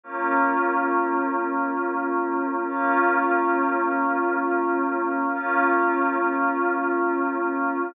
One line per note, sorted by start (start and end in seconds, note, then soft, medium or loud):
0.04 2.65 A#3 medium
0.04 2.65 C#4 medium
0.04 2.65 F4 medium
2.67 5.28 A#3 medium
2.67 5.28 C#4 medium
2.67 5.28 F4 medium
5.31 7.92 A#3 medium
5.31 7.92 C#4 medium
5.31 7.92 F4 medium